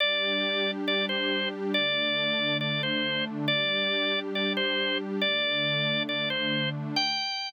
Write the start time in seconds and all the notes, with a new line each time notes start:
0.00 G3 D4 G4 D5
0.88 D5
1.09 C5
1.74 D3 A3 D4 D5
2.61 D5
2.83 C5
3.47 G3 D4 G4 D5
4.35 D5
4.57 C5
5.21 D3 A3 D4 D5
6.09 D5
6.30 C5
6.96 G5